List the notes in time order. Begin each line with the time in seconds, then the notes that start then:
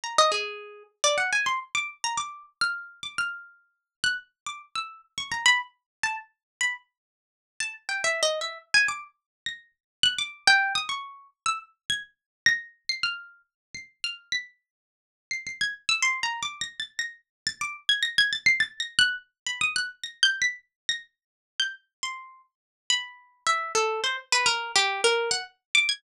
0.04 A#5
0.18 D#5
0.32 G#4
1.04 D5
1.18 F#5
1.33 G#5
1.46 C6
1.75 D6
2.04 A#5
2.17 D6
2.61 F6
3.03 D6
3.18 F6
4.04 F#6
4.46 D6
4.75 E6
5.18 C#6
5.32 A#5
5.46 B5
6.03 A5
6.61 B5
7.60 A5
7.89 G5
8.04 E5
8.23 D#5
8.41 E5
8.74 G#5
8.88 D6
9.46 A#6
10.03 F#6
10.18 D6
10.47 G5
10.75 D#6
10.89 C#6
11.46 E6
11.90 G#6
12.46 A#6
12.89 C7
13.03 F6
13.75 C7
14.04 F6
14.32 B6
15.31 C7
15.47 C7
15.61 G#6
15.89 E6
16.02 C6
16.23 A#5
16.43 D6
16.61 A#6
16.80 A6
16.99 A#6
17.47 A6
17.61 D6
17.89 G#6
18.03 A#6
18.18 G#6
18.33 A6
18.46 C7
18.60 A6
18.80 A#6
18.99 F#6
19.46 B5
19.61 D#6
19.76 F#6
20.03 A#6
20.23 G6
20.42 B6
20.89 A#6
21.60 G6
22.03 C6
22.90 B5
23.47 E5
23.75 A4
24.04 C5
24.32 B4
24.46 A#4
24.75 G4
25.04 A#4
25.31 F#5
25.75 D6
25.89 G#6